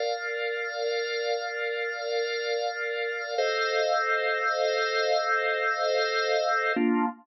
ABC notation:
X:1
M:4/4
L:1/8
Q:1/4=71
K:Bb
V:1 name="Drawbar Organ"
[Bdf]8 | [Acef]8 | [B,DF]2 z6 |]